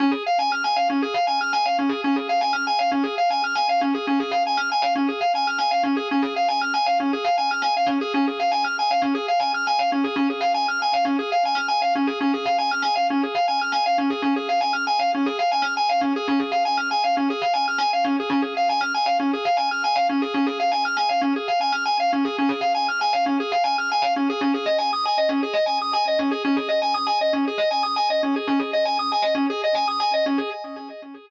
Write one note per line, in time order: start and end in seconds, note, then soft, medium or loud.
0.00 0.11 C#4 loud
0.11 0.23 G#4 medium
0.26 0.38 F5 medium
0.39 0.50 G#5 medium
0.52 0.63 F6 medium
0.64 0.76 G#5 medium
0.76 0.88 F5 medium
0.90 1.01 C#4 medium
1.02 1.14 G#4 medium
1.14 1.26 F5 medium
1.27 1.39 G#5 medium
1.41 1.52 F6 medium
1.53 1.64 G#5 loud
1.66 1.77 F5 medium
1.79 1.90 C#4 medium
1.89 2.01 G#4 medium
2.04 2.16 C#4 loud
2.16 2.28 G#4 medium
2.29 2.41 F5 medium
2.41 2.52 G#5 medium
2.53 2.64 F6 loud
2.67 2.78 G#5 medium
2.79 2.90 F5 medium
2.92 3.03 C#4 medium
3.03 3.15 G#4 medium
3.18 3.29 F5 medium
3.30 3.42 G#5 medium
3.44 3.55 F6 medium
3.55 3.67 G#5 medium
3.69 3.81 F5 loud
3.81 3.93 C#4 medium
3.94 4.06 G#4 medium
4.07 4.19 C#4 loud
4.20 4.31 G#4 medium
4.31 4.43 F5 medium
4.47 4.58 G#5 medium
4.57 4.69 F6 loud
4.72 4.83 G#5 medium
4.82 4.93 F5 medium
4.95 5.07 C#4 medium
5.08 5.20 G#4 medium
5.21 5.32 F5 medium
5.35 5.46 G#5 medium
5.47 5.59 F6 medium
5.58 5.70 G#5 medium
5.71 5.83 F5 medium
5.83 5.95 C#4 medium
5.97 6.08 G#4 medium
6.11 6.23 C#4 loud
6.22 6.34 G#4 medium
6.36 6.48 F5 medium
6.48 6.60 G#5 medium
6.61 6.73 F6 medium
6.74 6.85 G#5 medium
6.86 6.98 F5 medium
7.00 7.11 C#4 medium
7.13 7.24 G#4 medium
7.24 7.36 F5 medium
7.38 7.49 G#5 medium
7.51 7.62 F6 medium
7.62 7.73 G#5 medium
7.77 7.88 F5 medium
7.86 7.98 C#4 medium
8.01 8.13 G#4 loud
8.14 8.26 C#4 loud
8.27 8.39 G#4 medium
8.40 8.51 F5 medium
8.51 8.63 G#5 medium
8.64 8.76 F6 medium
8.79 8.90 G#5 medium
8.91 9.02 F5 medium
9.02 9.13 C#4 medium
9.15 9.26 G#4 medium
9.28 9.40 F5 medium
9.40 9.51 G#5 medium
9.54 9.66 F6 medium
9.67 9.78 G#5 loud
9.79 9.90 F5 medium
9.92 10.03 C#4 medium
10.04 10.16 G#4 medium
10.16 10.27 C#4 loud
10.30 10.41 G#4 medium
10.41 10.52 F5 medium
10.54 10.66 G#5 medium
10.68 10.80 F6 loud
10.82 10.93 G#5 medium
10.93 11.05 F5 medium
11.05 11.16 C#4 medium
11.19 11.30 G#4 medium
11.32 11.43 F5 medium
11.45 11.57 G#5 medium
11.55 11.66 F6 medium
11.68 11.80 G#5 medium
11.82 11.93 F5 loud
11.95 12.07 C#4 medium
12.07 12.19 G#4 medium
12.21 12.32 C#4 loud
12.34 12.45 G#4 medium
12.45 12.57 F5 medium
12.58 12.70 G#5 medium
12.71 12.83 F6 loud
12.82 12.94 G#5 medium
12.96 13.07 F5 medium
13.10 13.22 C#4 medium
13.23 13.35 G#4 medium
13.35 13.46 F5 medium
13.48 13.59 G#5 medium
13.61 13.73 F6 medium
13.72 13.84 G#5 medium
13.86 13.97 F5 medium
13.98 14.10 C#4 medium
14.10 14.22 G#4 medium
14.22 14.34 C#4 loud
14.36 14.48 G#4 medium
14.49 14.60 F5 medium
14.61 14.72 G#5 medium
14.73 14.85 F6 medium
14.87 14.98 G#5 medium
14.99 15.11 F5 medium
15.15 15.26 C#4 medium
15.26 15.38 G#4 medium
15.39 15.50 F5 medium
15.52 15.63 G#5 medium
15.62 15.73 F6 medium
15.77 15.88 G#5 medium
15.89 16.01 F5 medium
16.01 16.13 C#4 medium
16.16 16.27 G#4 loud
16.28 16.39 C#4 loud
16.40 16.51 G#4 medium
16.52 16.63 F5 medium
16.65 16.76 G#5 medium
16.77 16.89 F6 medium
16.91 17.02 G#5 medium
17.04 17.15 F5 medium
17.17 17.28 C#4 medium
17.30 17.41 G#4 medium
17.42 17.53 F5 medium
17.53 17.65 G#5 medium
17.68 17.79 F6 medium
17.78 17.90 G#5 loud
17.93 18.04 F5 medium
18.04 18.16 C#4 medium
18.20 18.31 G#4 medium
18.30 18.41 C#4 loud
18.42 18.54 G#4 medium
18.57 18.68 F5 medium
18.69 18.81 G#5 medium
18.81 18.92 F6 loud
18.94 19.06 G#5 medium
19.06 19.17 F5 medium
19.20 19.31 C#4 medium
19.33 19.45 G#4 medium
19.45 19.56 F5 medium
19.57 19.68 G#5 medium
19.71 19.83 F6 medium
19.84 19.95 G#5 medium
19.96 20.07 F5 loud
20.09 20.21 C#4 medium
20.22 20.33 G#4 medium
20.34 20.46 C#4 loud
20.47 20.58 G#4 medium
20.60 20.71 F5 medium
20.72 20.83 G#5 medium
20.85 20.96 F6 loud
20.97 21.08 G#5 medium
21.09 21.21 F5 medium
21.21 21.33 C#4 medium
21.36 21.47 G#4 medium
21.48 21.59 F5 medium
21.61 21.72 G#5 medium
21.72 21.84 F6 medium
21.85 21.97 G#5 medium
22.00 22.11 F5 medium
22.13 22.24 C#4 medium
22.25 22.36 G#4 medium
22.38 22.50 C#4 loud
22.49 22.60 G#4 medium
22.61 22.72 F5 medium
22.75 22.86 G#5 medium
22.88 23.00 F6 medium
23.01 23.12 G#5 medium
23.13 23.24 F5 medium
23.26 23.38 C#4 medium
23.40 23.51 G#4 medium
23.52 23.63 F5 medium
23.64 23.75 G#5 medium
23.78 23.90 F6 medium
23.92 24.03 G#5 medium
24.02 24.13 F5 medium
24.16 24.28 C#4 medium
24.30 24.41 G#4 loud
24.41 24.52 C#4 loud
24.54 24.66 G#4 medium
24.66 24.77 D#5 medium
24.78 24.90 G#5 medium
24.93 25.04 D#6 medium
25.05 25.17 G#5 medium
25.18 25.29 D#5 medium
25.29 25.40 C#4 medium
25.43 25.54 G#4 medium
25.53 25.65 D#5 medium
25.66 25.78 G#5 medium
25.82 25.93 D#6 medium
25.93 26.05 G#5 medium
26.08 26.19 D#5 medium
26.19 26.30 C#4 medium
26.31 26.43 G#4 medium
26.45 26.56 C#4 loud
26.56 26.68 G#4 medium
26.69 26.80 D#5 medium
26.82 26.93 G#5 medium
26.94 27.06 D#6 medium
27.07 27.18 G#5 medium
27.21 27.33 D#5 medium
27.33 27.44 C#4 medium
27.47 27.59 G#4 medium
27.58 27.69 D#5 medium
27.71 27.82 G#5 medium
27.83 27.94 D#6 medium
27.96 28.08 G#5 medium
28.10 28.22 D#5 medium
28.23 28.34 C#4 medium
28.36 28.47 G#4 medium
28.47 28.59 C#4 loud
28.59 28.71 G#4 medium
28.73 28.85 D#5 medium
28.85 28.97 G#5 medium
28.99 29.10 D#6 medium
29.12 29.23 G#5 medium
29.22 29.34 D#5 medium
29.35 29.46 C#4 medium
29.50 29.61 G#4 loud
29.64 29.75 D#5 medium
29.75 29.86 G#5 medium
29.88 29.99 D#6 medium
30.00 30.11 G#5 medium
30.14 30.25 D#5 medium
30.26 30.37 C#4 medium
30.38 30.49 G#4 medium